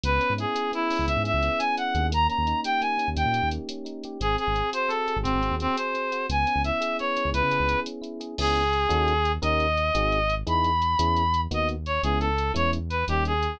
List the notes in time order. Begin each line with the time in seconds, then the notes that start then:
0.03 C#2 B3 B4, closed hi-hat
0.20 C#4, closed hi-hat
0.30 G#2
0.38 E4 G#4, closed hi-hat
0.55 G#4, closed hi-hat
0.72 B3 E4, closed hi-hat
0.90 C#4, open hi-hat
0.99 C#2
1.07 C#2 E4 E5, closed hi-hat
1.17 G#2
1.24 G#4 E5, closed hi-hat
1.34 C#2
1.43 B3, closed hi-hat
1.59 C#4 G#5, closed hi-hat
1.77 E4 F#5, closed hi-hat
1.95 D#2 G#4, closed hi-hat
2.12 A#3 A#5, closed hi-hat
2.27 C#4 A#5, closed hi-hat
2.38 D#2
2.47 D#4, closed hi-hat
2.64 G4 G5, closed hi-hat
2.81 A#3 G#5, closed hi-hat
2.98 C#4, closed hi-hat
3.08 D#2
3.16 D#2 D#4 G5, closed hi-hat
3.25 A#2
3.33 G4, closed hi-hat
3.43 D#2
3.51 A#3, closed hi-hat
3.69 C#4, closed hi-hat
3.85 D#4, closed hi-hat
4.03 G4, closed hi-hat
4.20 G#1 C4 G#4, closed hi-hat
4.38 G#4, closed hi-hat
4.47 G#1
4.55 C4, closed hi-hat
4.73 F#4 C5, closed hi-hat
4.88 C4 A4, closed hi-hat
5.08 G#4, closed hi-hat
5.16 G#1
5.23 G#1 C4 F#4, closed hi-hat
5.34 G#1
5.42 C4, closed hi-hat
5.51 D#2
5.60 C4, closed hi-hat
5.76 G#4 C5, closed hi-hat
5.94 C4, closed hi-hat
6.12 F#4, closed hi-hat
6.29 C#2 B3 G#5, closed hi-hat
6.47 C#4, closed hi-hat
6.56 C#2
6.64 E4 E5, closed hi-hat
6.81 G#4, closed hi-hat
6.99 B3 C#5, closed hi-hat
7.17 C#4, closed hi-hat
7.25 C#2
7.34 C#2 E4 B4, closed hi-hat
7.43 C#3
7.51 G#4, closed hi-hat
7.60 C#2
7.69 B3, closed hi-hat
7.86 C#4, closed hi-hat
8.02 E4, closed hi-hat
8.20 G#4, closed hi-hat
8.38 C#2 B3 C#4 E4 G#4, crash
8.56 closed hi-hat
8.73 closed hi-hat
8.89 D#2 C#4 D#4 F#4 A4, closed hi-hat
9.08 closed hi-hat
9.25 closed hi-hat
9.42 D#2 C#4 D#4 G4 A#4 D#5, closed hi-hat
9.60 closed hi-hat
9.77 closed hi-hat
9.95 G#1 C4 D#4 F#4 G#4, closed hi-hat
10.12 closed hi-hat
10.30 closed hi-hat
10.47 E2 B3 D#4 E4 G#4 B5, closed hi-hat
10.64 closed hi-hat
10.82 closed hi-hat
10.99 E2 B3 C#4 E4 G#4, closed hi-hat
11.17 closed hi-hat
11.34 closed hi-hat
11.51 D#2 A#3 B3 D#4 F#4 D#5, closed hi-hat
11.69 closed hi-hat
11.86 C#5, closed hi-hat
12.03 C#2 G#3 B3 C#4 E4 G#4, closed hi-hat
12.20 A4, closed hi-hat
12.38 closed hi-hat
12.54 E2 G#3 B3 C#4 E4 C#5, closed hi-hat
12.73 closed hi-hat
12.90 B4, closed hi-hat
13.08 D#2 G3 A#3 C#4 D#4 G4, closed hi-hat
13.25 G#4, closed hi-hat
13.43 closed hi-hat